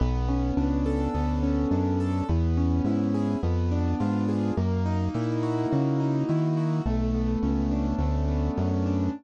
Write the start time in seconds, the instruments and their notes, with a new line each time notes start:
0.00 synth bass 1 B1, acoustic grand piano B3
0.29 acoustic grand piano C#4
0.57 synth bass 1 C#2, acoustic grand piano D4
0.86 acoustic grand piano A4
1.14 synth bass 1 D2, acoustic grand piano B3
1.43 acoustic grand piano C#4
1.71 synth bass 1 F#2, acoustic grand piano D4
2.00 acoustic grand piano A4
2.29 synth bass 1 E2, acoustic grand piano B3
2.57 acoustic grand piano C#4
2.84 synth bass 1 G#2, acoustic grand piano E4
3.14 acoustic grand piano G#4
3.43 synth bass 1 F2, acoustic grand piano B3
3.71 acoustic grand piano D4
4.00 synth bass 1 G#2, acoustic grand piano F4
4.29 acoustic grand piano G#4
4.57 synth bass 1 F#2, acoustic grand piano A#3
4.86 acoustic grand piano D#4
5.14 synth bass 1 A#2, acoustic grand piano E4
5.43 acoustic grand piano F#4
5.71 synth bass 1 C#3, acoustic grand piano A#3
6.00 acoustic grand piano D#4
6.29 synth bass 1 D#3, acoustic grand piano E4
6.57 acoustic grand piano F#4
6.86 synth bass 1 B1, acoustic grand piano A3
7.14 acoustic grand piano B3
7.43 synth bass 1 C#2, acoustic grand piano C#4
7.71 acoustic grand piano D4
7.98 synth bass 1 D2, acoustic grand piano A3
8.29 acoustic grand piano B3
8.57 synth bass 1 F#2, acoustic grand piano C#4
8.86 acoustic grand piano D4